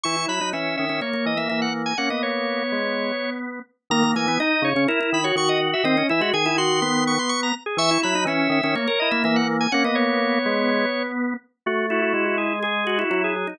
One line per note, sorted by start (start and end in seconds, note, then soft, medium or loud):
0.03 0.26 E3 medium
0.03 0.16 E4 medium
0.03 0.26 C#6 medium
0.17 0.28 E4 medium
0.28 0.40 F#3 medium
0.28 0.40 E4 medium
0.28 0.50 B5 medium
0.41 0.53 F#3 medium
0.41 0.52 D#4 medium
0.53 0.76 E3 medium
0.53 0.85 C#4 medium
0.53 0.76 E5 medium
0.77 0.89 D#3 medium
0.77 1.00 E5 medium
0.89 1.01 D#3 medium
0.89 1.01 C#4 medium
1.01 1.13 A#3 medium
1.01 1.25 C#5 medium
1.13 1.35 A#3 medium
1.26 1.48 E3 medium
1.26 1.38 D#5 medium
1.37 1.49 A#3 medium
1.37 1.48 E5 medium
1.49 1.94 E3 medium
1.49 1.93 A#3 medium
1.49 1.60 E5 medium
1.62 1.73 F#5 medium
1.86 1.97 G#5 medium
1.98 2.63 A#3 medium
1.98 2.10 C#4 medium
1.98 2.09 F#5 medium
2.10 3.60 B3 medium
2.10 2.22 D#5 medium
2.23 3.30 C#5 medium
2.72 3.12 G#3 medium
3.90 4.14 D#3 loud
3.90 4.03 A#3 loud
3.90 4.11 A#5 loud
4.04 4.15 A#3 loud
4.16 4.26 E3 medium
4.16 4.27 A#3 loud
4.16 4.39 G#5 medium
4.27 4.38 E3 loud
4.27 4.39 B3 loud
4.40 4.69 D#4 loud
4.40 4.63 D#4 loud
4.40 4.63 D#5 medium
4.62 4.73 C#3 loud
4.62 4.84 C#5 loud
4.75 4.87 C#3 loud
4.75 4.88 C#4 loud
4.88 5.00 E4 loud
4.88 5.10 A#4 loud
5.01 5.21 E4 loud
5.13 5.32 D#3 medium
5.13 5.25 B5 medium
5.24 5.36 F#4 loud
5.24 5.35 C#5 medium
5.36 5.74 D#3 loud
5.36 5.83 F#4 loud
5.36 5.49 C#6 medium
5.49 5.60 D#5 medium
5.73 5.85 E5 medium
5.84 6.03 D#3 loud
5.84 5.96 C4 loud
5.84 6.07 D#5 loud
5.97 6.09 C#4 loud
6.09 6.22 E3 loud
6.09 6.21 E4 loud
6.09 6.30 E5 medium
6.21 6.32 G#3 loud
6.21 6.33 F#4 loud
6.33 7.18 D#3 loud
6.33 6.45 G#4 loud
6.33 6.56 G#5 medium
6.46 6.57 E4 loud
6.58 6.80 F#4 loud
6.58 6.81 C6 medium
6.82 7.52 B3 loud
6.82 7.04 C6 loud
7.07 7.19 C#6 medium
7.19 7.31 C6 medium
7.29 7.41 C#6 loud
7.43 7.54 A#5 medium
7.66 7.78 G#4 medium
7.77 7.98 E3 loud
7.77 7.90 E5 loud
7.77 8.00 C#6 loud
7.91 8.02 E4 loud
8.03 8.14 F#3 loud
8.03 8.14 E4 loud
8.03 8.24 B5 loud
8.15 8.26 F#3 loud
8.15 8.27 D#4 loud
8.25 8.48 E3 medium
8.25 8.59 C#4 loud
8.25 8.51 E5 medium
8.49 8.61 D#3 loud
8.49 8.74 E5 medium
8.63 8.75 D#3 loud
8.63 8.75 C#4 loud
8.75 8.87 A#3 loud
8.75 8.99 C#5 medium
8.88 9.09 A#4 loud
8.99 9.24 E4 loud
8.99 9.11 D#5 medium
9.11 9.23 A#3 loud
9.11 9.22 E5 medium
9.24 9.67 E3 loud
9.24 9.67 A#3 loud
9.24 9.36 E5 loud
9.36 9.47 F#5 medium
9.60 9.72 G#5 medium
9.72 10.39 A#3 loud
9.72 9.84 C#4 loud
9.72 9.83 F#5 loud
9.84 11.34 B3 loud
9.84 9.96 D#5 medium
9.95 11.03 C#5 medium
10.46 10.86 G#3 loud
11.66 12.13 A3 loud
11.66 11.86 F#4 medium
11.90 12.53 E4 loud
11.90 12.01 F#4 medium
12.02 12.13 F#4 medium
12.14 13.04 G#3 loud
12.14 12.25 F#4 medium
12.25 12.37 F#4 medium
12.38 12.59 G#4 medium
12.63 12.84 G#4 loud
12.63 12.99 G#4 medium
12.87 12.98 F#4 loud
12.98 13.10 E4 loud
12.98 13.10 F#4 medium
13.10 13.54 F#3 medium
13.10 13.34 E4 loud
13.10 13.22 F#4 medium
13.24 13.35 G#4 medium
13.36 13.47 G#4 medium
13.47 13.59 D#4 loud